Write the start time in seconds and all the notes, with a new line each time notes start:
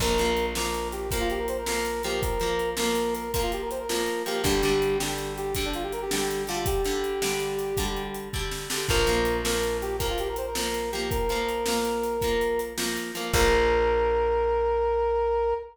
0.00 A#1 F3 A#3 A#4, kick, crash
0.18 F3 A#3, closed hi-hat
0.37 closed hi-hat
0.55 F3 A#3 A#4, snare
0.74 closed hi-hat
0.92 G4, closed hi-hat
1.11 F3 A#3 A#4, kick, closed hi-hat
1.20 F4
1.30 G4, closed hi-hat
1.39 A#4
1.48 C5, closed hi-hat
1.58 A#4
1.66 F3 A#3 A#4, snare
1.85 closed hi-hat
2.03 F3 A#3 G4, closed hi-hat
2.22 A#4, kick, closed hi-hat
2.40 F3 A#3, closed hi-hat
2.59 closed hi-hat
2.77 F3 A#3 A#4, snare
2.95 closed hi-hat
3.15 A#4, closed hi-hat
3.34 F3 A#3 A#4, kick, closed hi-hat
3.43 F4
3.52 G4, closed hi-hat
3.62 A#4
3.71 C5, closed hi-hat
3.80 A#4
3.89 F3 A#3 A#4, snare
4.06 closed hi-hat
4.26 F3 A#3 G4, closed hi-hat
4.44 G1 D3 G3 G4, kick, closed hi-hat
4.63 D3 G3, closed hi-hat
4.82 closed hi-hat
4.99 D3 G3 G4, snare
5.18 closed hi-hat
5.38 G4, closed hi-hat
5.55 D3 G3 G4, kick, closed hi-hat
5.66 D4
5.73 F4, closed hi-hat
5.83 G4
5.93 A#4, closed hi-hat
6.02 G4
6.11 D3 G3 G4, snare
6.31 closed hi-hat
6.47 D3 G3 F4, closed hi-hat
6.66 G4, kick, closed hi-hat
6.85 D3 G3, closed hi-hat
7.04 closed hi-hat
7.22 D3 G3, snare
7.40 closed hi-hat
7.59 closed hi-hat
7.77 D3 G3, kick, closed hi-hat
7.97 closed hi-hat
8.15 closed hi-hat
8.33 D3 G3, kick
8.51 snare
8.70 D3 G3, snare
8.89 A#1 F3 A#3 A#4, kick, crash
9.07 F3 A#3, closed hi-hat
9.25 closed hi-hat
9.45 F3 A#3 A#4, snare
9.63 closed hi-hat
9.82 G4, closed hi-hat
9.99 F3 A#3 A#4, kick, closed hi-hat
10.10 F4
10.18 G4, closed hi-hat
10.28 A#4
10.36 C5, closed hi-hat
10.47 A#4
10.55 F3 A#3 A#4, snare
10.74 closed hi-hat
10.92 F3 A#3 G4, closed hi-hat
11.10 A#4, kick, closed hi-hat
11.29 F3 A#3, closed hi-hat
11.49 closed hi-hat
11.66 F3 A#3, snare
11.85 closed hi-hat
12.03 closed hi-hat
12.21 F3 A#3, kick, closed hi-hat
12.41 closed hi-hat
12.59 closed hi-hat
12.78 F3 A#3, snare
12.97 closed hi-hat
13.15 F3 A#3, closed hi-hat
13.33 A#1 F3 A#3 A#4, kick, crash